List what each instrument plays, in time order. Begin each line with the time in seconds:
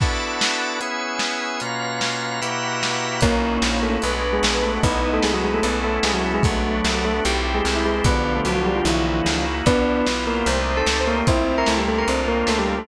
0.00 drawbar organ B3 D4 E4 F#4 A4 B4 D5 E5 F#5 A5, kick, crash
0.41 snare
0.81 drawbar organ B3 C#4 E4 G#4 B4 C#5 E5 G#5, closed hi-hat
1.19 snare
1.60 drawbar organ B2 A#3 C#4 F4 B4 C#5 F5 A#5, closed hi-hat
2.01 snare
2.41 drawbar organ B2 A#3 E4 F#4 G4 B4 E5 F#5 G5 A#5, closed hi-hat
2.83 snare
3.21 electric bass (finger) B1, brass section A#3 C#4, drawbar organ A#3 D#4 E4 F#4, tubular bells A#3 A#4, kick, closed hi-hat
3.62 electric bass (finger) A#1, snare
3.83 tubular bells A3 A4
4.02 electric bass (finger) B1, drawbar organ G#3 B3 D4 F#4, brass section B4, closed hi-hat
4.33 tubular bells G#3 G#4
4.43 electric bass (finger) A#1, snare
4.53 brass section B4
4.63 tubular bells A3 A4
4.82 electric bass (finger) B1, drawbar organ G#3 B3 D#4 E4, brass section B3 D#4, tubular bells B3 B4, kick, closed hi-hat
5.14 tubular bells A3 A4
5.22 electric bass (finger) C2, tubular bells G#3 G#4, snare
5.33 tubular bells F#3 F#4
5.44 tubular bells G#3 G#4
5.54 tubular bells A3 A4
5.63 electric bass (finger) B1, drawbar organ A3 B3 C#4 E4, tubular bells B3 B4, closed hi-hat
5.84 tubular bells A3 A4
6.03 electric bass (finger) C2, tubular bells G#3 G#4, snare
6.14 tubular bells F#3 F#4
6.34 tubular bells G#3 G#4
6.43 electric bass (finger) B1, brass section F#3 A3, tubular bells A3 A4, drawbar organ A3 B3 D4 F#4, kick, closed hi-hat
6.84 electric bass (finger) C2, snare
7.05 tubular bells A3 A4
7.24 electric bass (finger) B1, drawbar organ A3 C4 E4 G4, brass section G4, closed hi-hat
7.55 tubular bells G#3 G#4
7.65 electric bass (finger) C2, snare
7.74 brass section E4
7.86 tubular bells G#3 G#4
8.04 electric bass (finger) B1, brass section D3 F3, drawbar organ B3 D4 F4 G4, tubular bells B3 B4, kick, closed hi-hat
8.36 tubular bells A3 A4
8.45 electric bass (finger) C2, tubular bells F#3 F#4, closed hi-hat
8.55 tubular bells F#3 F#4
8.66 tubular bells G3 G4
8.76 tubular bells F3 F4
8.85 electric bass (finger) B1, tubular bells E3 E4, drawbar organ A#3 D#4 E4 F#4, closed hi-hat
9.26 electric bass (finger) C#2, snare
9.66 electric bass (finger) C2, brass section B3 D4, drawbar organ B3 E4 F4 G4, tubular bells B3 B4, kick, closed hi-hat
10.07 electric bass (finger) B1, snare
10.27 tubular bells A#3 A#4
10.46 electric bass (finger) C2, drawbar organ A3 C4 D#4 G4, brass section C5, closed hi-hat
10.77 tubular bells A4 A5
10.86 electric bass (finger) C#2, snare
10.99 brass section C5
11.07 tubular bells A#3 A#4
11.27 electric bass (finger) C2, drawbar organ A3 C4 E4 F4, brass section C4 E4, tubular bells C4 C5, kick, closed hi-hat
11.58 tubular bells A#4 A#5
11.66 electric bass (finger) C#2, tubular bells A3 A4, snare
11.78 tubular bells G3 G4
11.88 tubular bells A3 A4, drawbar organ A#3 C4 D4 F4
11.98 tubular bells A#4 A#5
12.08 electric bass (finger) C2, drawbar organ A#3 C4 D4 F4, tubular bells C4 C5, closed hi-hat
12.28 tubular bells A#3 A#4
12.47 electric bass (finger) C#2, tubular bells A3 A4, snare
12.59 tubular bells G3 G4
12.78 tubular bells A3 A4